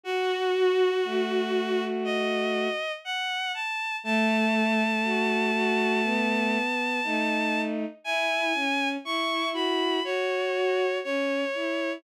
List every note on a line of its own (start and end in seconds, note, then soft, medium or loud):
0.04 0.49 F#4 medium
0.04 0.91 F#4 loud
0.04 1.84 F#4 loud
0.55 2.69 F#4 medium
1.05 2.68 A3 medium
2.04 2.92 D#5 medium
3.05 3.52 F#5 medium
3.54 3.96 A5 medium
4.04 4.84 A3 medium
4.04 6.58 A3 loud
4.04 7.61 A5 medium
5.04 5.51 F#4 medium
5.54 6.01 F#4 medium
6.04 7.00 B3 medium
7.04 7.85 A3 medium
7.04 7.85 D#4 medium
8.04 8.47 E4 medium
8.04 8.53 E4 medium
8.04 8.89 G#5 loud
8.55 8.97 C#4 medium
9.04 9.53 E4 medium
9.04 10.00 E4 medium
9.04 9.49 C#6 medium
9.53 10.00 F#4 medium
9.53 10.03 B5 medium
10.04 10.86 F#4 medium
10.04 10.98 C#5 medium
10.55 11.00 F#4 medium
11.04 11.45 C#4 medium
11.04 11.93 C#5 medium
11.54 11.98 E4 medium